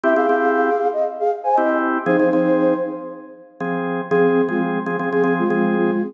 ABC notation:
X:1
M:4/4
L:1/16
Q:1/4=118
K:Fm
V:1 name="Flute"
[G=e] [Af]6 _e z [Af] z [ca] e2 z2 | [Ec]6 z10 | [CA] [CA]2 [A,F] z4 [CA]2 [A,F]3 [A,F]2 [CA] |]
V:2 name="Drawbar Organ"
[C=EG] [CEG] [CEG]10 [CEG]4 | [F,CA] [F,CA] [F,CA]10 [F,CA]4 | [F,CA]3 [F,CA]3 [F,CA] [F,CA] [F,CA] [F,CA]2 [F,CA]5 |]